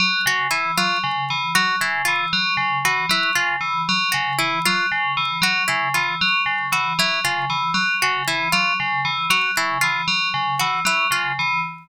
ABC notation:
X:1
M:5/8
L:1/8
Q:1/4=116
K:none
V:1 name="Tubular Bells" clef=bass
_G, _D, E, G, D, | E, _G, _D, E, G, | _D, E, _G, D, E, | _G, _D, E, G, D, |
E, _G, _D, E, G, | _D, E, _G, D, E, | _G, _D, E, G, D, | E, _G, _D, E, G, |
_D, E, _G, D, E, |]
V:2 name="Orchestral Harp"
z _G E F z | z _G E F z | z _G E F z | z _G E F z |
z _G E F z | z _G E F z | z _G E F z | z _G E F z |
z _G E F z |]